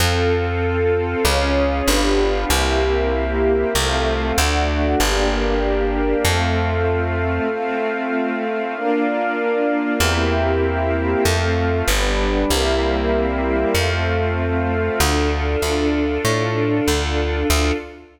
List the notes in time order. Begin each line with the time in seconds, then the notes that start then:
0.00 F2 C4 F4 A4 C5 F5
1.24 C#2 C#4 F4 G#4 C#5 F5
1.87 G1 B3 D4 F4 G4 B4 D5 F5
2.49 C2 A#3 C4 E4 G4 A#4 C5 E5
3.75 C2 A3 C4 F4 A4 C5 F5
4.37 D2 A3 D4 F#4 A4 D5 F#5
4.98 G1 A#3 D4 G4 A#4 D5 G5
6.24 F2 A3 C4 F4 A4 C5 F5
7.50 A3 C4 F4 A4 C5 F5
8.74 A#3 D4 F4 A#4 D5 F5
10.00 E2 A#3 C4 E4 G4 A#4 C5 E5 G5
11.24 F2 A3 C4 F4 A4 C5 F5
11.88 G1 G3 B3 D4 G4 B4 D5
12.50 C2 G3 A#3 C4 E4 G4 A#4 C5 E5
13.75 F2 A3 C4 F4 A4 C5 F5
14.99 D2 D4 F4 A4
15.62 D2
16.25 A2
16.88 D2
17.50 D2 D4 F4 A4